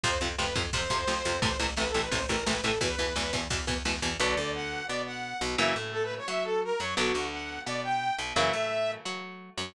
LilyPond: <<
  \new Staff \with { instrumentName = "Lead 2 (sawtooth)" } { \time 4/4 \key a \minor \tempo 4 = 173 c''8 r8 b'8 r8 c''2 | c''8 r8 \tuplet 3/2 { b'8 a'8 b'8 } c''8 ais'8 b'8 a'8 | b'4. r2 r8 | \key b \minor d''4 fis''4 d''8 fis''4 r8 |
e''8 r8 \tuplet 3/2 { a'8 b'8 cis''8 } e''8 a'8 ais'8 cis''8 | fis'4 fis''4 d''8 g''4 r8 | e''2 r2 | }
  \new Staff \with { instrumentName = "Overdriven Guitar" } { \time 4/4 \key a \minor <c f>8 <c f>8 <c f>8 <c f>8 <c f>8 <c f>8 <c f>8 <c f>8 | <a, c e>8 <a, c e>8 <a, c e>8 <a, c e>8 <a, c e>8 <a, c e>8 <a, c e>8 <a, c e>8 | <b, e>8 <b, e>8 <b, e>8 <b, e>8 <b, e>8 <b, e>8 <b, e>8 <b, e>8 | \key b \minor <d fis b>8 d4. b4. b,8 |
<cis e fis ais>8 a4. fis'4. fis8 | <d fis b>8 d4. b4. b,8 | <cis e fis ais>8 a4. fis'4. fis8 | }
  \new Staff \with { instrumentName = "Electric Bass (finger)" } { \clef bass \time 4/4 \key a \minor f,8 f,8 f,8 f,8 f,8 f,8 f,8 f,8 | a,,8 a,,8 a,,8 a,,8 a,,8 a,,8 a,,8 a,,8 | e,8 e,8 e,8 e,8 e,8 e,8 e,8 e,8 | \key b \minor b,,8 d,4. b,4. b,,8 |
fis,8 a,4. fis4. fis,8 | b,,8 d,4. b,4. b,,8 | fis,8 a,4. fis4. fis,8 | }
  \new DrumStaff \with { instrumentName = "Drums" } \drummode { \time 4/4 <bd cymr>8 cymr8 sn8 <bd cymr>8 <bd cymr>8 <bd cymr>8 sn8 cymr8 | <bd cymr>8 cymr8 sn8 cymr8 <bd cymr>8 <bd cymr>8 sn8 cymr8 | <bd cymr>8 cymr8 sn8 <bd cymr>8 <bd cymr>8 <bd cymr>8 sn8 cymr8 | r4 r4 r4 r4 |
r4 r4 r4 r4 | r4 r4 r4 r4 | r4 r4 r4 r4 | }
>>